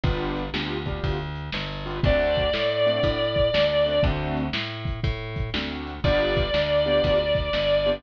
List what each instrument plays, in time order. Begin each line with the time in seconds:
0.03 electric bass (finger) G1, acoustic grand piano B3 D4 F4 G4, kick, closed hi-hat
0.36 closed hi-hat
0.54 electric bass (finger) D2, acoustic grand piano B3 D4 F4 G4, snare
0.86 acoustic grand piano B3 D4 F4 G4, kick, closed hi-hat
1.04 electric bass (finger) D2, kick, closed hi-hat
1.35 closed hi-hat
1.52 electric bass (finger) G1, snare
1.86 acoustic grand piano B3 D4 F4 G4, closed hi-hat
2.03 electric bass (finger) D2, acoustic grand piano A3 C4 D4 F#4, distortion guitar D5, kick, closed hi-hat
2.35 kick, closed hi-hat
2.53 electric bass (finger) A2, snare
2.86 acoustic grand piano A3 C4 D4 F#4, closed hi-hat
3.03 electric bass (finger) A2, kick, closed hi-hat
3.36 kick, closed hi-hat
3.54 electric bass (finger) D2, snare
3.86 acoustic grand piano A3 C4 D4 F#4, closed hi-hat
4.03 electric bass (finger) D2, acoustic grand piano A3 C4 D4 F#4, kick, closed hi-hat
4.37 closed hi-hat
4.53 electric bass (finger) A2, snare
4.85 kick, closed hi-hat
5.03 electric bass (finger) A2, kick, closed hi-hat
5.36 kick, closed hi-hat
5.54 electric bass (finger) D2, acoustic grand piano A3 C4 D4 F#4, snare
5.87 closed hi-hat
6.04 electric bass (finger) G1, acoustic grand piano B3 D4 F4 G4, distortion guitar D5, kick, closed hi-hat
6.36 kick, closed hi-hat
6.54 electric bass (finger) D2, snare
6.85 acoustic grand piano B3 D4 F4 G4, closed hi-hat
7.04 electric bass (finger) D2, kick, closed hi-hat
7.35 kick, closed hi-hat
7.53 electric bass (finger) G1, snare
7.86 acoustic grand piano B3 D4 F4 G4, closed hi-hat